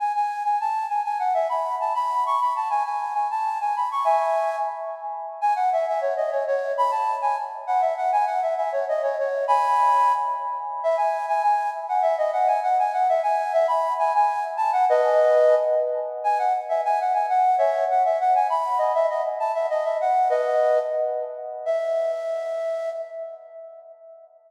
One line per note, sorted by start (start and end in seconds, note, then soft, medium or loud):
0.00 0.12 G#5 medium
0.15 0.43 G#5 medium
0.45 0.59 G#5 medium
0.61 0.86 A5 medium
0.89 1.02 G#5 medium
1.05 1.18 G#5 medium
1.19 1.33 F#5 medium
1.34 1.48 E5 medium
1.49 1.75 B5 medium
1.80 1.93 A5 medium
1.95 2.24 B5 loud
2.26 2.40 C#6 medium
2.41 2.53 B5 medium
2.56 2.68 A5 medium
2.70 2.83 G#5 medium
2.85 3.13 G#5 medium
3.14 3.28 G#5 medium
3.31 3.58 A5 medium
3.61 3.75 G#5 medium
3.76 3.89 B5 medium
3.91 4.05 C#6 medium
4.04 4.56 E5 medium
4.04 4.56 G#5 loud
5.41 5.54 G#5 loud
5.56 5.69 F#5 medium
5.73 5.86 E5 medium
5.88 6.01 E5 loud
6.01 6.14 C#5 medium
6.17 6.30 D#5 medium
6.31 6.44 C#5 medium
6.47 6.72 C#5 loud
6.78 6.91 B5 loud
6.91 7.15 A5 medium
7.22 7.36 G#5 loud
7.67 7.81 F#5 loud
7.81 7.94 E5 medium
7.97 8.11 F#5 medium
8.12 8.25 G#5 loud
8.27 8.40 F#5 medium
8.42 8.54 E5 medium
8.57 8.71 E5 medium
8.72 8.85 C#5 medium
8.89 9.02 D#5 medium
9.03 9.16 C#5 medium
9.19 9.45 C#5 medium
9.48 10.12 G#5 loud
9.48 10.12 B5 loud
10.83 10.96 E5 loud
10.97 11.26 G#5 medium
11.28 11.42 G#5 loud
11.42 11.70 G#5 loud
11.89 12.02 F#5 medium
12.02 12.16 E5 loud
12.18 12.31 D#5 loud
12.33 12.47 F#5 medium
12.47 12.60 G#5 medium
12.63 12.77 F#5 medium
12.79 12.92 G#5 medium
12.93 13.07 F#5 loud
13.09 13.21 E5 loud
13.23 13.52 G#5 loud
13.53 13.66 E5 loud
13.68 13.93 B5 medium
13.99 14.13 G#5 loud
14.15 14.44 G#5 loud
14.57 14.71 A5 loud
14.73 14.85 F#5 loud
14.89 15.55 B4 loud
14.89 15.55 D#5 loud
16.24 16.38 G#5 loud
16.39 16.53 F#5 medium
16.69 16.81 E5 medium
16.85 16.99 G#5 loud
17.01 17.13 F#5 medium
17.14 17.26 G#5 medium
17.29 17.56 F#5 medium
17.58 17.84 C#5 medium
17.58 17.84 E5 loud
17.91 18.03 F#5 medium
18.05 18.18 E5 medium
18.20 18.34 F#5 medium
18.35 18.47 G#5 medium
18.50 18.78 B5 medium
18.78 18.92 D#5 loud
18.95 19.07 E5 loud
19.10 19.22 D#5 medium
19.40 19.52 A5 medium
19.54 19.67 E5 medium
19.70 19.84 D#5 loud
19.85 19.97 E5 medium
20.01 20.28 F#5 medium
20.30 20.79 B4 loud
20.30 20.79 D#5 loud
21.66 22.89 E5 loud